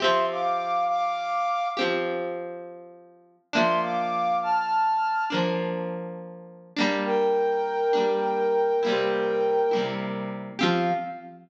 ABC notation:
X:1
M:12/8
L:1/8
Q:3/8=68
K:F
V:1 name="Flute"
[ec'] [fd']2 [fd']3 z6 | [ec'] [fd']2 [af']3 z6 | [Bg]10 z2 | f3 z9 |]
V:2 name="Overdriven Guitar"
[F,CG]6 [F,CG]6 | [F,B,D]6 [F,B,D]5 [G,B,D]- | [G,B,D]3 [G,B,D]3 [C,G,B,E]3 [C,G,B,E]3 | [F,CG]3 z9 |]